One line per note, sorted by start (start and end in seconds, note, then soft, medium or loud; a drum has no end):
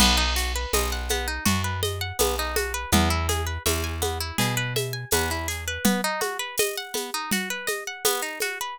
0.00 0.66 B1 loud
0.00 0.16 B3 loud
0.00 crash loud
0.00 low conga loud
0.00 shaker medium
0.17 0.34 D#4 medium
0.36 0.53 F#4 medium
0.36 shaker medium
0.55 0.72 B4 medium
0.73 1.39 B1 medium
0.73 0.90 D#5 medium
0.73 tambourine medium
0.73 high conga medium
0.73 shaker medium
0.92 1.09 F#5 medium
1.09 1.27 B3 medium
1.09 high conga medium
1.09 shaker medium
1.28 1.44 D#4 medium
1.45 2.12 F#2 medium
1.45 1.62 F#4 medium
1.45 low conga loud
1.45 shaker medium
1.64 1.81 B4 medium
1.83 1.99 D#5 medium
1.83 high conga medium
1.83 shaker medium
2.01 2.18 F#5 medium
2.19 2.86 B1 medium
2.19 2.36 B3 medium
2.19 tambourine medium
2.19 high conga loud
2.19 shaker loud
2.39 2.55 D#4 medium
2.56 2.73 F#4 medium
2.56 high conga medium
2.56 shaker medium
2.74 2.91 B4 loud
2.92 3.58 E2 loud
2.92 3.09 B3 loud
2.92 low conga loud
2.92 shaker medium
3.10 3.27 E4 medium
3.29 3.45 G#4 medium
3.29 high conga medium
3.29 shaker medium
3.46 3.63 B4 medium
3.66 4.32 E2 medium
3.66 3.82 E5 medium
3.66 tambourine medium
3.66 high conga medium
3.66 shaker medium
3.84 4.00 G#5 medium
4.02 4.18 B3 medium
4.02 high conga medium
4.02 shaker medium
4.20 4.37 E4 medium
4.38 5.05 B2 medium
4.38 4.55 G#4 medium
4.38 low conga medium
4.38 shaker medium
4.57 4.73 B4 loud
4.76 4.93 E5 medium
4.76 high conga medium
4.76 shaker medium
4.93 5.10 G#5 medium
5.11 5.78 E2 medium
5.11 5.30 B3 loud
5.11 tambourine medium
5.11 high conga loud
5.11 shaker medium
5.31 5.47 E4 medium
5.48 5.64 G#4 medium
5.48 shaker medium
5.68 5.84 B4 medium
5.85 6.01 B3 loud
5.85 low conga loud
5.85 shaker medium
6.04 6.21 D#4 medium
6.21 6.37 F#4 medium
6.21 high conga medium
6.21 shaker medium
6.39 6.56 B4 medium
6.58 6.76 D#5 loud
6.58 tambourine medium
6.58 high conga loud
6.58 shaker loud
6.77 6.94 F#5 medium
6.94 7.11 B3 medium
6.94 high conga medium
6.94 shaker medium
7.14 7.30 D#4 medium
7.31 7.49 F#4 loud
7.31 low conga loud
7.31 shaker medium
7.50 7.67 B4 medium
7.67 7.84 D#5 medium
7.67 high conga medium
7.67 shaker medium
7.87 8.04 F#5 medium
8.05 8.21 B3 loud
8.05 tambourine loud
8.05 high conga loud
8.05 shaker loud
8.22 8.39 D#4 medium
8.40 8.58 F#4 medium
8.40 high conga medium
8.40 shaker medium
8.61 8.77 B4 medium